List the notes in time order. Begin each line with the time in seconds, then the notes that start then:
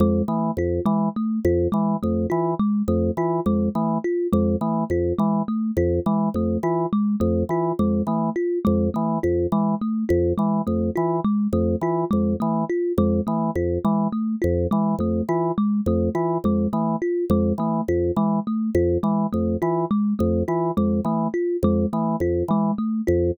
0.00 F2 G#3
0.28 E3 A3
0.57 F2 F4
0.86 E3 G#3
1.16 A3
1.45 F2 F4
1.72 E3 G#3
2.03 F2 A3
2.30 E3 F4
2.59 G#3
2.88 F2 A3
3.17 E3 F4
3.46 F2 G#3
3.75 E3 A3
4.04 F4
4.33 F2 G#3
4.61 E3 A3
4.90 F2 F4
5.19 E3 G#3
5.48 A3
5.77 F2 F4
6.06 E3 G#3
6.34 F2 A3
6.63 E3 F4
6.93 G#3
7.20 F2 A3
7.49 E3 F4
7.79 F2 G#3
8.07 E3 A3
8.36 F4
8.65 F2 G#3
8.94 E3 A3
9.23 F2 F4
9.52 E3 G#3
9.81 A3
10.09 F2 F4
10.38 E3 G#3
10.67 F2 A3
10.96 E3 F4
11.25 G#3
11.53 F2 A3
11.81 E3 F4
12.11 F2 G#3
12.40 E3 A3
12.69 F4
12.98 F2 G#3
13.27 E3 A3
13.55 F2 F4
13.85 E3 G#3
14.12 A3
14.42 F2 F4
14.71 E3 G#3
14.99 F2 A3
15.29 E3 F4
15.58 G#3
15.86 F2 A3
16.15 E3 F4
16.44 F2 G#3
16.73 E3 A3
17.02 F4
17.30 F2 G#3
17.58 E3 A3
17.88 F2 F4
18.16 E3 G#3
18.47 A3
18.75 F2 F4
19.03 E3 G#3
19.33 F2 A3
19.62 E3 F4
19.91 G#3
20.19 F2 A3
20.48 E3 F4
20.77 F2 G#3
21.05 E3 A3
21.34 F4
21.63 F2 G#3
21.93 E3 A3
22.20 F2 F4
22.48 E3 G#3
22.78 A3
23.07 F2 F4